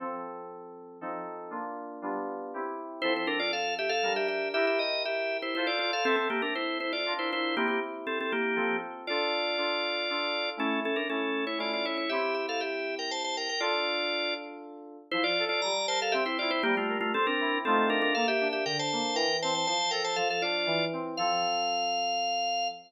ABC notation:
X:1
M:3/4
L:1/16
Q:1/4=119
K:F
V:1 name="Drawbar Organ"
z12 | z12 | [Ec] [Ec] [DB] [Fd] [Af]2 [Ge] [Af]2 [Ge] [Ge]2 | [Ge] [Ge] ^d2 [Ge]3 [Ec] [Ec] [F=d] [Fd] [Af] |
[CA] [CA] [B,G] [DB] [Ec]2 [Ec] [Fd]2 [Ec] [Ec]2 | [B,G] [B,G] z2 [CA] [CA] [B,G]4 z2 | [K:Dm] [Fd]12 | [^CA]2 [CA] [DB] [CA]3 [E^c] [Fd] [Fd] [Ec] [Ec] |
[Ge]2 [Ge] [Af] [Ge]3 [Bg] [ca] [ca] [Bg] [Bg] | [Fd]6 z6 | [K:F] [Ec] [Fd]2 [Fd] [db]2 [ca] [Af] [Ge] [Ec] [Fd] [Ec] | [B,G] [A,F]2 [A,F] [CA] [DB]3 [CA]2 [DB] [DB] |
[Af] [Ge]2 [Ge] [Bg] [ca]3 [Bg]2 [ca] [ca] | [ca]2 [Bg] [ca] [Af] [Af] [Fd]4 z2 | f12 |]
V:2 name="Electric Piano 2"
[F,CA]8 [F,C_EA]4 | [B,DF]4 [G,=B,DF]4 [CEG]4 | [F,CA]8 [G,DB]4 | [EGB]8 [FAc]4 |
[CAe]8 [DFB]4 | [CEG]8 [F,CA]4 | [K:Dm] [DFA]4 [DFA]4 [DFA]4 | [A,^CE]4 [A,CE]4 [A,CE]4 |
[CEG]12 | [DFA]12 | [K:F] F,2 A2 G,2 B2 C2 E2 | G,2 B2 C2 E2 [A,C_EF]4 |
B,2 D2 D,2 B,2 E,2 C2 | F,2 A2 F,2 D2 E,2 C2 | [F,CA]12 |]